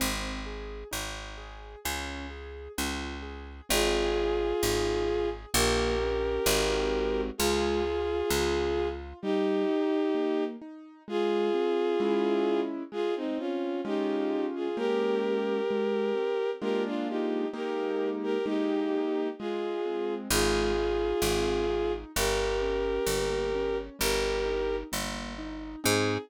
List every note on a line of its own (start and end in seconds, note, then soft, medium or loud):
0.00 0.84 G#1 medium
0.00 0.41 C4 loud
0.46 0.88 G#4 medium
0.91 1.76 G#1 medium
0.91 1.33 D#4 medium
1.38 1.79 G#4 medium
1.85 2.68 C#2 medium
1.85 2.26 C#4 medium
2.30 2.72 G#4 medium
2.78 3.61 C#2 medium
2.78 3.19 F4 medium
3.22 3.64 G#4 medium
3.69 4.53 G#1 loud
3.69 4.11 C4 loud
3.69 5.29 F4 medium
3.69 5.29 G#4 loud
4.15 4.56 G#4 medium
4.63 5.46 G#1 medium
4.63 5.04 D#4 medium
5.08 5.49 G#4 medium
5.54 6.39 A#1 loud
5.54 5.95 A#3 loud
5.54 7.21 G4 medium
5.54 7.21 A#4 loud
6.01 6.42 C#4 medium
6.46 7.31 G#1 loud
6.46 7.29 G#3 medium
6.46 7.29 C4 loud
6.46 7.29 D#4 medium
6.46 7.29 F#4 medium
7.38 8.23 C#2 medium
7.38 7.81 G#3 medium
7.38 8.88 F4 medium
7.38 8.88 G#4 loud
7.85 8.26 F4 medium
8.30 9.13 C#2 medium
8.30 8.71 C#4 medium
8.77 9.19 F4 medium
9.22 9.65 G3 medium
9.22 10.44 D#4 loud
9.22 10.44 G4 loud
9.69 10.10 D#4 medium
10.15 10.56 A#3 medium
10.62 11.03 D#4 medium
11.08 11.49 G#3 loud
11.08 12.61 F4 loud
11.08 12.61 G#4 loud
11.54 11.96 C4 medium
12.00 12.83 G#3 loud
12.00 12.83 C#4 loud
12.00 12.83 E4 loud
12.92 13.33 G#3 loud
12.92 13.14 F4 medium
12.92 13.14 G#4 loud
13.16 13.38 C4 medium
13.16 13.38 D#4 medium
13.38 13.80 C4 medium
13.38 13.81 C#4 medium
13.38 13.81 F4 medium
13.85 14.68 G#3 loud
13.85 14.68 C#4 loud
13.85 14.46 D#4 medium
13.85 14.68 F4 loud
13.85 14.46 G4 medium
14.55 14.77 F4 medium
14.55 14.77 G#4 medium
14.77 15.60 G#3 loud
14.77 15.60 A#3 medium
14.77 15.60 C#4 medium
14.77 16.50 G4 medium
14.77 15.60 G4 loud
14.77 16.50 A#4 loud
15.71 16.12 G#3 loud
16.15 16.56 C4 medium
16.61 17.45 G#3 loud
16.61 17.45 A#3 loud
16.61 17.45 D4 loud
16.61 17.45 F4 loud
16.61 16.83 G4 medium
16.61 16.83 A#4 loud
16.86 17.08 D4 medium
16.86 17.08 F4 medium
17.08 17.48 D#4 medium
17.08 17.48 G4 medium
17.53 18.37 G#3 loud
17.53 18.37 A#3 loud
17.53 18.37 D#4 loud
17.53 18.37 G4 loud
17.53 18.09 G4 medium
17.53 18.09 A#4 medium
18.23 18.45 G4 medium
18.23 18.45 A#4 medium
18.46 19.29 G#3 loud
18.46 19.29 A#3 loud
18.46 19.28 D#4 medium
18.46 19.29 D#4 loud
18.46 19.28 G4 medium
18.46 19.29 G4 medium
19.39 20.28 G#3 loud
19.39 20.14 F4 medium
19.39 20.14 G#4 medium
19.85 20.29 C4 medium
20.30 21.13 G#1 loud
20.30 20.72 G#3 medium
20.30 21.93 F4 medium
20.30 21.93 G#4 loud
20.77 21.19 D#4 medium
21.22 22.05 G#1 medium
21.22 21.65 C4 medium
21.70 22.11 D#4 medium
22.15 22.99 G1 medium
22.15 22.58 G3 medium
22.15 23.77 G4 medium
22.15 23.77 A#4 loud
22.61 23.03 C#4 medium
23.07 23.90 G1 medium
23.07 23.49 A#3 medium
23.55 23.97 C#4 medium
23.99 24.84 G1 loud
23.99 24.41 G3 medium
23.99 24.76 G4 medium
23.99 24.76 A#4 medium
24.45 24.87 D#4 medium
24.92 25.76 G1 medium
24.92 25.33 A#3 medium
25.38 25.80 D#4 medium
25.84 26.18 G#2 loud
25.84 26.16 C4 loud
25.84 26.16 D#4 loud
25.84 26.16 G#4 loud
25.84 26.17 G#4 loud